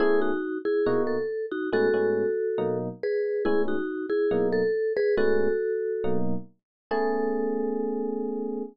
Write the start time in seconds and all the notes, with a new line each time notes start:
0.00 A3 B3 C#4 E4 G#4
0.21 D#4 F#4
0.65 E4 G#4
0.86 B2 A#3 D#4 F#4
1.07 A4
1.52 D#4 F#4
1.72 A2 G#3 B3 C#4 F#4 A4
1.94 A2 G#3 B3 C#4
2.58 B2 F#3 A#3 D#4
3.03 G#4 B4
3.45 A2 G#3 B3 C#4 E4 G#4
3.68 D#4 F#4
4.10 E4 G#4
4.31 B2 F#3 A#3 D#4
4.53 A4
4.97 G#4 B4
5.17 A2 G#3 B3 C#4 F#4 A4
6.04 B2 F#3 A#3 D#4
6.91 A3 B3 C#4 G#4 A4